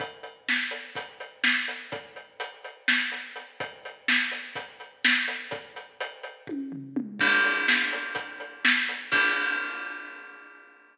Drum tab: CC |--------|-------|--------|-------|
HH |xx-xxx-x|xxxx-xx|xx-xxx-x|xxxx---|
SD |--o---o-|----o--|--o---o-|-------|
T1 |--------|-------|--------|----o--|
T2 |--------|-------|--------|------o|
FT |--------|-------|--------|-----o-|
BD |o---o---|o------|o---o---|o---o--|

CC |x-------|x------|
HH |-x-xxx-x|-------|
SD |--o---o-|-------|
T1 |--------|-------|
T2 |--------|-------|
FT |--------|-------|
BD |o---o---|o------|